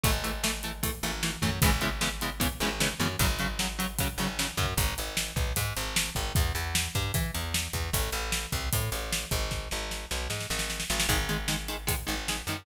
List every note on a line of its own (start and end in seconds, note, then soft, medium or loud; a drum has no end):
0.04 0.89 G#1 loud
0.04 0.11 E3 medium
0.04 0.11 A3 loud
0.04 kick loud
0.04 closed hi-hat loud
0.24 0.32 E3 medium
0.24 0.32 A3 medium
0.24 closed hi-hat medium
0.43 0.51 E3 medium
0.43 0.51 A3 medium
0.43 snare loud
0.63 0.72 E3 medium
0.63 0.72 A3 medium
0.63 closed hi-hat medium
0.83 0.91 E3 medium
0.83 0.91 A3 medium
0.83 kick medium
0.83 closed hi-hat loud
1.03 1.37 G#1 medium
1.03 1.11 E3 medium
1.03 1.11 A3 medium
1.03 closed hi-hat medium
1.23 1.31 E3 medium
1.23 1.31 A3 medium
1.23 snare loud
1.42 1.60 F#2 loud
1.42 1.50 E3 medium
1.42 1.50 A3 medium
1.42 kick medium
1.42 closed hi-hat medium
1.62 2.46 G#1 loud
1.62 1.70 C#3 loud
1.62 1.70 E3 loud
1.62 1.70 G#3 loud
1.62 1.70 B3 loud
1.62 kick loud
1.62 closed hi-hat loud
1.81 1.89 C#3 medium
1.81 1.89 E3 medium
1.81 1.89 G#3 medium
1.81 1.89 B3 medium
1.81 closed hi-hat medium
2.01 2.09 C#3 medium
2.01 2.09 E3 medium
2.01 2.09 G#3 medium
2.01 2.09 B3 medium
2.01 snare loud
2.21 2.30 C#3 medium
2.21 2.30 E3 medium
2.21 2.30 G#3 medium
2.21 2.30 B3 medium
2.21 closed hi-hat medium
2.40 2.48 C#3 medium
2.40 2.48 E3 medium
2.40 2.48 G#3 medium
2.40 2.48 B3 medium
2.40 kick medium
2.40 closed hi-hat loud
2.60 2.94 G#1 loud
2.60 2.70 C#3 medium
2.60 2.70 E3 medium
2.60 2.70 G#3 medium
2.60 2.70 B3 medium
2.60 closed hi-hat medium
2.80 2.88 C#3 medium
2.80 2.88 E3 medium
2.80 2.88 G#3 medium
2.80 2.88 B3 medium
2.80 snare loud
3.00 3.16 F#2 loud
3.00 3.08 C#3 medium
3.00 3.08 E3 medium
3.00 3.08 G#3 medium
3.00 3.08 B3 medium
3.00 closed hi-hat medium
3.19 4.04 G#1 loud
3.19 3.27 C#3 loud
3.19 3.27 F#3 loud
3.19 kick loud
3.19 closed hi-hat loud
3.39 3.47 C#3 medium
3.39 3.47 F#3 medium
3.39 closed hi-hat medium
3.59 3.67 C#3 medium
3.59 3.67 F#3 medium
3.59 snare loud
3.79 3.87 C#3 medium
3.79 3.87 F#3 medium
3.79 closed hi-hat medium
3.99 4.08 C#3 loud
3.99 4.08 F#3 medium
3.99 kick medium
3.99 closed hi-hat loud
4.18 4.51 G#1 medium
4.18 4.27 C#3 medium
4.18 4.27 F#3 medium
4.18 closed hi-hat medium
4.39 4.47 C#3 medium
4.39 4.47 F#3 medium
4.39 snare loud
4.57 4.74 F#2 loud
4.57 4.66 C#3 medium
4.57 4.66 F#3 medium
4.57 kick medium
4.57 closed hi-hat medium
4.77 4.94 G#1 loud
4.77 kick loud
4.77 closed hi-hat loud
4.98 5.32 G#1 medium
4.98 closed hi-hat medium
5.17 snare loud
5.36 5.53 B1 medium
5.36 kick loud
5.36 closed hi-hat medium
5.56 5.74 G#2 loud
5.56 kick medium
5.56 closed hi-hat loud
5.77 6.10 G#1 loud
5.77 closed hi-hat medium
5.96 snare loud
6.15 6.33 G#1 loud
6.15 kick medium
6.15 closed hi-hat medium
6.35 6.53 E2 loud
6.35 kick loud
6.35 closed hi-hat medium
6.55 6.88 E2 medium
6.55 closed hi-hat medium
6.75 snare loud
6.95 7.12 G2 loud
6.95 kick medium
6.95 closed hi-hat medium
7.14 7.31 E3 loud
7.14 kick loud
7.14 closed hi-hat loud
7.34 7.68 E2 medium
7.34 closed hi-hat medium
7.54 snare loud
7.73 7.90 E2 medium
7.73 kick medium
7.73 closed hi-hat medium
7.93 8.10 A1 loud
7.93 kick medium
7.93 closed hi-hat loud
8.12 8.46 A1 loud
8.12 closed hi-hat medium
8.32 snare loud
8.52 8.69 C2 medium
8.52 kick medium
8.52 closed hi-hat medium
8.73 8.90 A2 medium
8.73 kick medium
8.73 closed hi-hat loud
8.92 9.25 A1 medium
8.92 closed hi-hat medium
9.13 snare loud
9.31 9.68 G#1 loud
9.31 kick medium
9.31 closed hi-hat medium
9.51 kick medium
9.51 snare medium
9.71 10.06 G#1 medium
9.71 snare medium
9.91 snare medium
10.11 10.28 B1 medium
10.11 snare medium
10.30 10.47 G#2 medium
10.30 snare medium
10.40 snare medium
10.50 10.84 G#1 loud
10.50 snare medium
10.59 snare medium
10.70 snare medium
10.80 snare medium
10.90 11.07 G#1 loud
10.90 snare medium
11.00 snare loud
11.09 11.93 G#1 loud
11.09 11.17 D#3 medium
11.09 11.17 G#3 loud
11.09 kick medium
11.09 closed hi-hat medium
11.29 11.37 D#3 medium
11.29 11.37 G#3 medium
11.29 closed hi-hat medium
11.48 11.56 D#3 medium
11.48 11.56 G#3 medium
11.48 snare loud
11.68 11.76 D#3 medium
11.68 11.76 G#3 medium
11.68 closed hi-hat medium
11.87 11.95 D#3 loud
11.87 11.95 G#3 medium
11.87 kick medium
11.87 closed hi-hat loud
12.07 12.42 G#1 loud
12.07 12.15 D#3 medium
12.07 12.15 G#3 medium
12.07 closed hi-hat medium
12.28 12.37 D#3 medium
12.28 12.37 G#3 medium
12.28 snare loud
12.47 12.64 F#2 medium
12.47 12.57 D#3 medium
12.47 12.57 G#3 medium
12.47 closed hi-hat medium